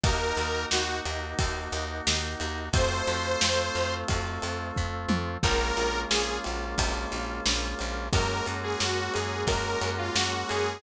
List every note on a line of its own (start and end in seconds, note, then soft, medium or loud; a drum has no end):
0.04 0.32 D#2 medium
0.04 2.69 A#3 medium
0.04 2.69 D#4 medium
0.04 2.69 F#4 medium
0.04 0.64 A#4 loud
0.04 kick loud
0.04 ride loud
0.37 0.65 D#2 medium
0.37 ride medium
0.71 1.01 D#2 medium
0.71 0.99 F#4 loud
0.71 snare loud
1.05 1.34 D#2 medium
1.05 ride medium
1.39 1.68 D#2 medium
1.39 kick loud
1.39 ride loud
1.72 2.01 D#2 medium
1.72 ride medium
2.07 2.36 D#2 medium
2.07 snare loud
2.40 2.69 D#2 medium
2.40 ride medium
2.73 3.02 F2 loud
2.73 5.38 A3 medium
2.73 5.38 C4 medium
2.73 5.38 F4 medium
2.73 3.94 C5 loud
2.73 kick loud
2.73 ride loud
3.07 3.36 F2 medium
3.07 ride medium
3.41 3.70 F2 medium
3.41 snare loud
3.75 4.04 F2 medium
3.75 ride medium
4.08 4.39 F2 medium
4.08 kick loud
4.08 ride loud
4.42 4.72 F2 medium
4.42 ride medium
4.76 5.06 F2 medium
4.76 kick medium
5.09 5.37 F2 medium
5.09 high tom loud
5.43 5.72 A#1 loud
5.43 8.08 G#3 medium
5.43 8.08 A#3 medium
5.43 8.08 C#4 medium
5.43 8.08 F4 medium
5.43 6.00 A#4 loud
5.43 kick loud
5.43 crash loud
5.77 6.06 A#1 medium
5.77 ride medium
6.10 6.39 A#1 medium
6.10 6.38 G#4 loud
6.10 snare loud
6.44 6.75 A#1 medium
6.44 ride medium
6.78 7.06 A#1 medium
6.78 kick medium
6.78 ride loud
7.12 7.41 A#1 medium
7.12 ride medium
7.46 7.75 A#1 loud
7.46 snare loud
7.79 8.09 A#1 medium
7.79 ride medium
8.13 8.41 F#2 loud
8.13 10.78 G#3 medium
8.13 10.78 A#3 medium
8.13 10.78 C#4 medium
8.13 10.78 F#4 medium
8.13 8.46 A#4 loud
8.13 kick loud
8.13 ride loud
8.46 8.76 F#2 medium
8.46 ride medium
8.63 8.79 G#4 loud
8.80 9.09 F#2 medium
8.80 9.12 F#4 loud
8.80 snare loud
9.14 9.44 F#2 medium
9.14 9.43 G#4 medium
9.14 ride medium
9.47 9.76 F#2 medium
9.47 9.90 A#4 loud
9.47 kick loud
9.47 ride loud
9.81 10.10 F#2 medium
9.81 ride medium
9.98 10.14 F4 loud
10.15 10.44 F#2 medium
10.15 10.31 F#4 loud
10.15 snare loud
10.33 10.49 F#4 loud
10.49 10.79 F#2 medium
10.49 10.81 G#4 loud
10.49 ride medium